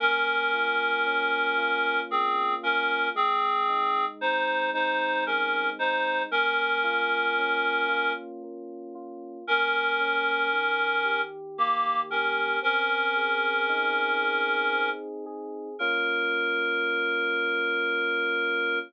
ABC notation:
X:1
M:3/4
L:1/8
Q:1/4=57
K:Bbm
V:1 name="Clarinet"
[DB]4 [CA] [DB] | [CA]2 [Ec] [Ec] [DB] [Ec] | [DB]4 z2 | [DB]4 [B,=G] [DB] |
[DB]5 z | B6 |]
V:2 name="Electric Piano 2"
B, F D F B, F | A, E C E A, E | B, F D F B, F | B, D E, =G B, G |
C A E A C A | [B,DF]6 |]